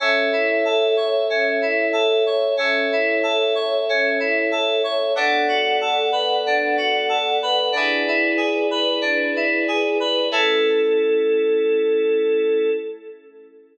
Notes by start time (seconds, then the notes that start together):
0.00 C#4 A4 C#5 E5
0.32 E4
0.65 A4
0.97 C#5
1.30 C#4
1.62 E4
1.93 A4
2.26 C#5
2.57 C#4 A4 C#5 E5
2.92 E4
3.23 A4
3.55 C#5
3.89 C#4
4.20 E4
4.52 A4
4.84 C#5
5.15 B3 D4 A4 D5 F#5
5.48 F#4
5.81 A4
6.12 B4
6.46 D4
6.77 F#4
7.09 A4
7.42 B4
7.72 D4 E4 G#4 B4 D5
8.08 E4
8.37 G#4
8.71 B4
9.01 D4
9.36 E4
9.68 G#4
10.00 B4
10.31 A3 C#4 E4 A4